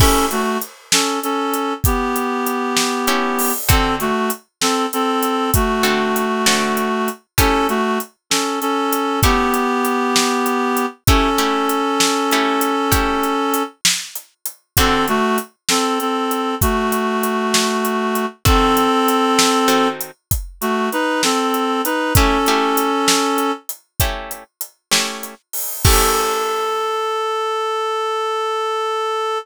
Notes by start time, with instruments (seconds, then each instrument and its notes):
0.00 acoustic guitar (steel) A3 C#4 E4 G4, clarinet C#4 A4, kick, crash
0.31 clarinet A3 F#4, closed hi-hat
0.62 closed hi-hat
0.92 clarinet C#4 A4, snare
1.23 clarinet C#4 A4, closed hi-hat
1.54 closed hi-hat
1.84 clarinet B3 G4, kick, closed hi-hat
2.16 closed hi-hat
2.47 closed hi-hat
2.77 snare
3.07 acoustic guitar (steel) A3 C#4 E4 G4, closed hi-hat
3.39 open hi-hat
3.69 acoustic guitar (steel) D3 C4 F#4 A4, clarinet C4 A4, kick, closed hi-hat
4.00 clarinet A3 F#4, closed hi-hat
4.30 closed hi-hat
4.61 clarinet C4 A4, snare
4.93 clarinet C4 A4, closed hi-hat
5.23 closed hi-hat
5.54 clarinet A3 F#4, kick, closed hi-hat
5.83 acoustic guitar (steel) D3 C4 F#4 A4, closed hi-hat
6.16 closed hi-hat
6.46 acoustic guitar (steel) D3 C4 F#4 A4, snare
6.77 closed hi-hat
7.08 closed hi-hat
7.38 acoustic guitar (steel) A3 C#4 E4 G4, clarinet C#4 A4, kick, closed hi-hat
7.69 clarinet A3 F#4, closed hi-hat
8.00 closed hi-hat
8.30 clarinet C#4 A4, snare
8.61 clarinet C#4 A4, closed hi-hat
8.93 closed hi-hat
9.23 acoustic guitar (steel) A3 C#4 E4 G4, clarinet B3 G4, kick, closed hi-hat
9.54 closed hi-hat
9.85 closed hi-hat
10.16 snare
10.46 closed hi-hat
10.77 closed hi-hat
11.07 acoustic guitar (steel) A3 C#4 E4 G4, clarinet C#4 A4, kick, closed hi-hat
11.38 acoustic guitar (steel) A3 C#4 E4 G4, closed hi-hat
11.69 closed hi-hat
12.00 snare
12.31 acoustic guitar (steel) A3 C#4 E4 G4, closed hi-hat
12.61 closed hi-hat
12.92 acoustic guitar (steel) A3 C#4 E4 G4, kick, closed hi-hat
13.23 closed hi-hat
13.54 closed hi-hat
13.85 snare
14.16 closed hi-hat
14.46 closed hi-hat
14.77 acoustic guitar (steel) D3 C4 F#4 A4, clarinet C4 A4, kick, closed hi-hat
15.08 clarinet A3 F#4, closed hi-hat
15.38 closed hi-hat
15.69 clarinet C4 A4, snare
16.00 clarinet C4 A4, closed hi-hat
16.31 closed hi-hat
16.61 clarinet A3 F#4, kick, closed hi-hat
16.92 closed hi-hat
17.23 closed hi-hat
17.54 snare
17.85 closed hi-hat
18.15 closed hi-hat
18.45 acoustic guitar (steel) D#3 C4 F#4 A4, clarinet C4 A4, kick, closed hi-hat
18.77 closed hi-hat
19.08 closed hi-hat
19.39 snare
19.68 acoustic guitar (steel) D#3 C4 F#4 A4, closed hi-hat
20.01 closed hi-hat
20.31 kick, closed hi-hat
20.61 clarinet A3 F#4, closed hi-hat
20.92 clarinet D#4 B4, closed hi-hat
21.23 clarinet C4 A4, snare
21.54 closed hi-hat
21.85 clarinet D#4 B4, closed hi-hat
22.15 acoustic guitar (steel) A3 C#4 E4 G4, clarinet C#4 A4, kick, closed hi-hat
22.46 acoustic guitar (steel) A3 C#4 E4 G4, closed hi-hat
22.77 closed hi-hat
23.08 snare
23.38 closed hi-hat
23.69 closed hi-hat
24.00 acoustic guitar (steel) A3 C#4 E4 G4, kick, closed hi-hat
24.31 closed hi-hat
24.61 closed hi-hat
24.91 acoustic guitar (steel) A3 C#4 E4 G4, snare
25.23 closed hi-hat
25.53 open hi-hat
25.85 acoustic guitar (steel) A3 C#4 E4 G4, clarinet A4, kick, crash